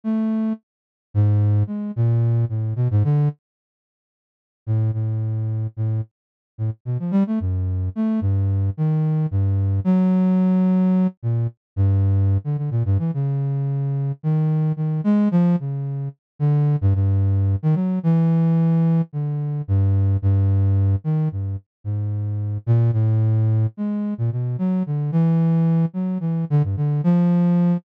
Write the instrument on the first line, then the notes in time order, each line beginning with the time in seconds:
flute
0.04 A3
1.14 G#2
1.67 G#3
1.96 A#2
2.49 A2
2.76 B2
2.91 G#2
3.04 D3
4.67 A2
4.93 A2
5.77 A2
6.58 A2
6.85 B2
6.99 F3
7.11 G3
7.27 A3
7.40 F#2
7.96 A3
8.21 G2
8.77 D#3
9.31 G2
9.84 F#3
11.23 A#2
11.76 G2
12.44 D3
12.58 D3
12.71 A#2
12.85 G2
12.99 E3
13.14 C#3
14.23 D#3
14.76 D#3
15.04 G#3
15.31 F3
15.60 C#3
16.39 D3
16.81 G2
16.95 G2
17.63 D#3
17.75 F#3
18.03 E3
19.13 D3
19.68 G2
20.22 G2
21.04 D#3
21.32 G2
21.84 G#2
22.66 A#2
22.93 A2
23.77 G#3
24.18 A#2
24.32 B2
24.58 F#3
24.86 D3
25.12 E3
25.94 F#3
26.20 E3
26.50 D3
26.64 G2
26.77 D3
27.04 F3